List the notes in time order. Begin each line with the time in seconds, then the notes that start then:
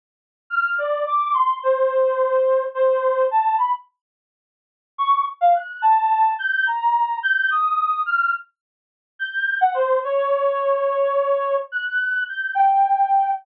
0.50 F6
0.78 D5
1.07 D6
1.34 C6
1.63 C5
2.74 C5
3.31 A5
3.58 B5
4.98 C#6
5.41 F5
5.55 F#6
5.82 A5
6.39 G6
6.67 A#5
7.23 G6
7.50 D#6
8.06 F6
9.19 G6
9.61 F#5
9.74 C5
10.04 C#5
11.72 F#6
12.28 G6
12.55 G5